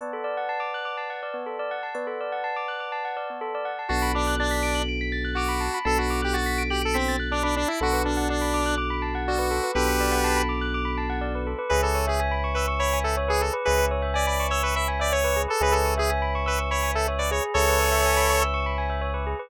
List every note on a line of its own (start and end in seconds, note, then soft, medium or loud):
0.01 0.12 B3 medium
0.01 1.76 B4 medium
0.01 1.76 D5 medium
0.01 1.76 F#5 medium
0.01 1.76 A5 medium
0.13 0.24 A4 medium
0.24 0.35 D5 medium
0.37 0.48 F#5 medium
0.49 0.60 A5 medium
0.60 0.71 D6 medium
0.74 0.85 F#6 medium
0.85 0.96 D6 medium
0.97 1.08 A5 medium
1.10 1.21 F#5 medium
1.23 1.34 D5 medium
1.34 1.45 B3 medium
1.46 1.57 A4 medium
1.59 1.70 D5 medium
1.71 1.82 F#5 medium
1.83 1.94 A5 medium
1.95 2.06 B3 medium
1.95 3.70 B4 medium
1.95 3.70 D5 medium
1.95 3.70 F#5 medium
1.95 3.70 A5 medium
2.07 2.18 A4 medium
2.21 2.32 D5 medium
2.32 2.43 F#5 medium
2.44 2.55 A5 medium
2.56 2.67 D6 medium
2.68 2.79 F#6 medium
2.80 2.91 D6 medium
2.92 3.03 A5 medium
3.05 3.16 F#5 medium
3.17 3.28 D5 medium
3.30 3.41 B3 medium
3.41 3.52 A4 medium
3.55 3.66 D5 medium
3.65 3.76 F#5 medium
3.79 3.89 A5 medium
3.89 5.69 B1 medium
3.89 5.66 B3 medium
3.89 5.66 D4 medium
3.89 4.12 F#4 medium
3.89 5.66 F#4 medium
3.89 5.66 A4 medium
3.89 4.01 A5 medium
4.02 4.13 B5 medium
4.15 4.35 D4 medium
4.15 4.26 D6 medium
4.27 4.38 F#6 medium
4.39 4.82 D4 medium
4.39 4.51 A6 medium
4.51 4.62 B6 medium
4.63 4.74 D7 medium
4.75 4.86 F#7 medium
4.89 4.99 D7 medium
5.01 5.12 B6 medium
5.12 5.23 A6 medium
5.24 5.35 F#6 medium
5.35 5.79 F#4 medium
5.35 5.48 D6 medium
5.48 5.59 B5 medium
5.60 5.71 A5 medium
5.74 5.85 B5 medium
5.85 7.65 B1 medium
5.85 7.61 B3 medium
5.85 7.61 D4 medium
5.85 7.61 F#4 medium
5.85 7.61 A4 medium
5.85 5.98 A4 loud
5.85 5.96 A5 loud
5.98 6.21 F#4 medium
5.98 6.09 B5 medium
6.10 6.21 D6 medium
6.22 6.36 G4 medium
6.22 6.33 F#6 medium
6.33 6.63 F#4 medium
6.33 6.45 A6 medium
6.46 6.57 B6 medium
6.58 6.69 D7 medium
6.70 6.82 G4 medium
6.70 6.81 F#7 medium
6.82 6.97 A4 medium
6.82 6.93 D7 medium
6.94 7.16 C4 medium
6.94 7.05 B6 medium
7.08 7.19 A6 medium
7.20 7.30 F#6 medium
7.31 7.43 D4 medium
7.31 7.43 D6 medium
7.43 7.55 D4 medium
7.43 7.54 B5 medium
7.56 7.68 D4 loud
7.56 7.67 A5 medium
7.68 7.79 E4 medium
7.68 7.80 B5 medium
7.81 9.60 B1 medium
7.81 9.57 B3 medium
7.81 9.57 D4 medium
7.81 9.57 F#4 medium
7.81 8.02 F#4 loud
7.81 7.92 A4 loud
7.81 9.57 A4 medium
7.93 8.04 B4 medium
8.05 8.28 D4 medium
8.05 8.16 D5 medium
8.17 8.28 F#5 medium
8.29 8.75 D4 medium
8.29 8.40 A5 medium
8.41 8.52 B5 medium
8.54 8.65 D6 medium
8.66 8.77 F#6 medium
8.78 8.89 D6 medium
8.90 9.01 B5 medium
9.02 9.13 A5 medium
9.15 9.26 F#5 medium
9.28 9.71 F#4 medium
9.28 9.39 D5 medium
9.39 9.50 B4 medium
9.51 9.62 A4 medium
9.64 9.74 B4 medium
9.75 11.55 B1 medium
9.75 11.50 B3 medium
9.75 11.50 D4 medium
9.75 11.50 F#4 medium
9.75 10.42 G4 medium
9.75 11.50 A4 medium
9.75 9.87 A4 loud
9.75 10.42 B4 medium
9.88 9.99 B4 medium
10.00 10.11 D5 medium
10.12 10.23 F#5 medium
10.24 10.35 A5 medium
10.37 10.48 B5 medium
10.49 10.60 D6 medium
10.61 10.72 F#6 medium
10.74 10.85 D6 medium
10.85 10.96 B5 medium
10.98 11.09 A5 medium
11.10 11.21 F#5 medium
11.21 11.32 D5 medium
11.35 11.46 B4 medium
11.47 11.58 A4 medium
11.59 11.70 B4 medium
11.69 13.51 C#2 medium
11.69 11.82 G#4 loud
11.69 11.81 B4 loud
11.69 13.46 B4 medium
11.69 13.46 C#5 medium
11.69 13.46 E5 medium
11.69 13.46 G#5 medium
11.82 12.05 A4 medium
11.82 11.95 B4 medium
11.95 12.06 C#5 medium
12.07 12.20 G#4 medium
12.07 12.18 E5 medium
12.20 12.31 G#5 loud
12.31 12.42 B5 medium
12.44 12.55 C#6 medium
12.54 12.66 B4 medium
12.54 12.67 E6 medium
12.68 12.79 C#6 medium
12.79 12.99 C#5 loud
12.79 12.91 B5 medium
12.93 13.04 G#5 medium
13.04 13.15 A4 medium
13.04 13.15 E5 medium
13.17 13.28 C#5 medium
13.28 13.41 G#4 loud
13.28 13.39 B4 medium
13.41 13.52 G#4 medium
13.41 13.53 A4 medium
13.53 13.64 B4 loud
13.65 15.47 C#2 medium
13.65 13.77 G#4 medium
13.65 13.85 B4 loud
13.65 15.41 B4 medium
13.65 15.41 C#5 medium
13.65 15.41 E5 medium
13.65 15.41 G#5 medium
13.78 13.89 B4 medium
13.91 14.02 C#5 medium
14.02 14.13 E5 medium
14.14 14.26 D5 loud
14.14 14.25 G#5 medium
14.26 14.47 D5 medium
14.26 14.38 B5 medium
14.40 14.51 C#6 medium
14.50 14.62 C#5 loud
14.50 14.62 E6 medium
14.63 14.75 B4 medium
14.63 14.74 C#6 medium
14.76 14.87 E5 medium
14.76 14.87 B5 medium
14.88 14.99 G#5 medium
14.99 15.12 D5 loud
14.99 15.10 E5 medium
15.12 15.42 C#5 loud
15.12 15.23 C#5 medium
15.24 15.35 B4 medium
15.36 15.47 G#4 medium
15.48 15.61 A4 loud
15.48 15.59 B4 medium
15.61 17.40 C#2 medium
15.61 15.72 G#4 loud
15.61 17.37 B4 medium
15.61 15.74 B4 loud
15.61 17.37 C#5 medium
15.61 17.37 E5 medium
15.61 17.37 G#5 medium
15.72 15.94 A4 medium
15.72 15.84 B4 medium
15.85 15.96 C#5 medium
15.97 16.10 G#4 loud
15.97 16.08 E5 medium
16.10 16.21 G#5 medium
16.22 16.33 B5 medium
16.35 16.46 C#6 medium
16.46 16.59 B4 loud
16.46 16.57 E6 medium
16.58 16.69 C#6 medium
16.71 16.91 C#5 loud
16.71 16.82 B5 medium
16.83 16.94 G#5 medium
16.95 17.07 A4 loud
16.95 17.06 E5 medium
17.08 17.19 C#5 medium
17.18 17.30 B4 medium
17.18 17.30 D5 medium
17.31 17.66 G#4 loud
17.31 17.43 C#5 medium
17.54 19.34 C#2 medium
17.54 18.43 A4 loud
17.54 19.32 B4 medium
17.54 18.43 C#5 loud
17.54 19.32 C#5 medium
17.54 19.32 E5 medium
17.54 19.32 G#5 medium
17.68 17.79 B4 medium
17.79 17.90 C#5 medium
17.92 18.03 E5 medium
18.06 18.17 G#5 medium
18.17 18.28 B5 medium
18.30 18.41 C#6 medium
18.42 18.53 E6 medium
18.54 18.65 C#6 medium
18.66 18.77 B5 medium
18.78 18.89 G#5 medium
18.90 19.01 E5 medium
19.02 19.13 C#5 medium
19.14 19.25 B4 medium
19.27 19.38 G#4 medium
19.39 19.50 B4 medium